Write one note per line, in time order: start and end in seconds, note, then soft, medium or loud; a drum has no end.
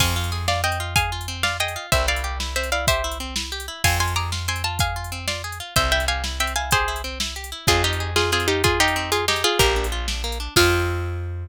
0.00 1.77 F2 loud
0.00 0.14 C4 medium
0.00 0.43 F5 medium
0.00 0.43 G#5 medium
0.00 kick loud
0.00 crash loud
0.16 0.31 F4 medium
0.24 closed hi-hat medium
0.32 0.46 G#4 medium
0.48 0.62 F4 medium
0.48 0.61 D5 medium
0.48 0.61 F5 medium
0.48 snare loud
0.64 0.78 C4 medium
0.64 0.95 D#5 medium
0.64 0.95 G5 medium
0.72 closed hi-hat medium
0.80 0.94 F4 medium
0.96 1.10 G#4 medium
0.96 1.37 F5 medium
0.96 1.37 G#5 medium
0.96 kick loud
0.96 closed hi-hat loud
1.12 1.27 F4 medium
1.21 closed hi-hat medium
1.28 1.42 C4 medium
1.43 1.58 F4 medium
1.43 1.57 D5 medium
1.43 1.57 F5 medium
1.43 snare loud
1.60 1.74 G#4 medium
1.60 1.86 D#5 medium
1.60 1.86 G5 medium
1.68 closed hi-hat medium
1.76 1.90 F4 medium
1.92 3.69 C2 medium
1.92 2.06 C4 medium
1.92 2.06 C5 medium
1.92 2.06 E5 medium
1.92 kick loud
1.92 closed hi-hat loud
2.08 2.22 E4 medium
2.08 2.36 D5 medium
2.08 2.36 F5 medium
2.16 closed hi-hat medium
2.24 2.38 G4 medium
2.40 2.54 E4 medium
2.40 snare loud
2.56 2.70 C4 medium
2.56 2.70 C5 medium
2.56 2.70 E5 medium
2.64 closed hi-hat medium
2.72 2.86 E4 medium
2.72 2.85 D5 medium
2.72 2.85 F5 medium
2.87 3.02 G4 medium
2.87 3.18 C5 medium
2.87 3.18 E5 medium
2.87 kick loud
2.87 closed hi-hat loud
3.04 3.19 E4 medium
3.11 closed hi-hat medium
3.20 3.34 C4 medium
3.36 3.50 E4 medium
3.36 snare loud
3.52 3.66 G4 medium
3.60 closed hi-hat medium
3.68 3.82 E4 medium
3.84 5.61 F2 loud
3.84 3.98 C4 medium
3.84 3.98 F5 medium
3.84 3.98 G#5 loud
3.84 kick loud
3.84 crash loud
4.00 4.14 F4 medium
4.00 4.14 G#5 medium
4.00 4.14 C6 medium
4.08 closed hi-hat medium
4.16 4.30 G#4 medium
4.16 4.31 A#5 medium
4.16 4.31 D6 medium
4.32 4.47 F4 medium
4.32 snare loud
4.48 4.62 C4 medium
4.48 4.63 G#5 medium
4.48 4.63 C6 medium
4.56 closed hi-hat medium
4.64 4.78 F4 medium
4.64 4.78 A5 medium
4.79 4.94 G#4 medium
4.79 5.19 F5 medium
4.79 5.19 G#5 medium
4.79 kick loud
4.79 closed hi-hat loud
4.96 5.10 F4 medium
5.04 closed hi-hat medium
5.12 5.26 C4 medium
5.28 5.42 F4 medium
5.28 5.42 D5 medium
5.28 5.42 F5 medium
5.28 snare loud
5.44 5.58 G#4 medium
5.52 closed hi-hat medium
5.60 5.74 F4 medium
5.76 7.53 C2 medium
5.76 5.90 C4 medium
5.76 5.91 C5 medium
5.76 5.91 E5 medium
5.76 kick loud
5.76 closed hi-hat loud
5.92 6.06 E4 medium
5.92 6.05 E5 medium
5.92 6.05 G5 medium
6.00 closed hi-hat medium
6.08 6.22 G4 medium
6.08 6.24 F5 medium
6.08 6.24 G#5 medium
6.24 6.38 E4 medium
6.24 snare loud
6.40 6.54 C4 medium
6.40 6.53 E5 medium
6.40 6.53 G5 medium
6.47 closed hi-hat medium
6.56 6.70 E4 medium
6.56 6.71 F5 medium
6.56 6.71 G#5 medium
6.71 6.86 G4 medium
6.71 7.02 G#4 medium
6.71 7.02 C5 medium
6.71 kick loud
6.71 closed hi-hat loud
6.88 7.02 E4 medium
6.96 closed hi-hat medium
7.04 7.18 C4 medium
7.20 7.34 E4 medium
7.20 snare loud
7.36 7.50 G4 medium
7.44 closed hi-hat medium
7.52 7.66 E4 medium
7.67 9.44 F2 loud
7.67 7.82 C4 loud
7.67 7.83 F4 medium
7.67 7.83 G#4 medium
7.67 kick loud
7.67 closed hi-hat loud
7.84 8.10 D#4 medium
7.84 7.98 F4 medium
7.84 8.10 G4 medium
7.93 closed hi-hat medium
8.00 8.15 G#4 medium
8.16 8.31 F4 medium
8.16 8.30 F4 medium
8.16 8.31 G#4 medium
8.16 snare loud
8.32 8.47 C4 medium
8.32 8.47 F4 medium
8.32 8.47 G#4 medium
8.40 closed hi-hat medium
8.48 8.62 D#4 medium
8.48 8.62 F4 medium
8.48 8.62 G4 medium
8.64 8.79 F4 medium
8.64 8.79 G#4 medium
8.64 8.78 G#4 medium
8.64 kick loud
8.64 closed hi-hat loud
8.80 9.11 D#4 medium
8.80 8.94 F4 medium
8.80 9.11 G4 medium
8.88 closed hi-hat medium
8.96 9.10 C4 medium
9.12 9.25 F4 medium
9.12 9.26 F4 medium
9.12 9.25 G#4 medium
9.12 closed hi-hat loud
9.28 9.43 D#4 medium
9.28 9.43 G4 medium
9.28 9.42 G#4 medium
9.28 snare loud
9.36 closed hi-hat medium
9.44 9.58 F4 medium
9.44 9.59 F4 medium
9.44 9.59 G#4 medium
9.59 10.48 A#1 loud
9.59 9.74 A#3 loud
9.59 9.87 G4 medium
9.59 9.87 A#4 medium
9.59 kick loud
9.59 closed hi-hat loud
9.76 9.90 D4 medium
9.84 closed hi-hat medium
9.92 10.06 F4 medium
10.08 10.22 D4 medium
10.08 snare loud
10.24 10.38 A#3 medium
10.32 closed hi-hat medium
10.40 10.54 D4 medium
10.56 11.47 F2 loud
10.56 11.46 C4 loud
10.56 11.47 F4 loud
10.56 11.46 F4 medium
10.56 11.46 G#4 loud
10.56 kick loud
10.56 crash loud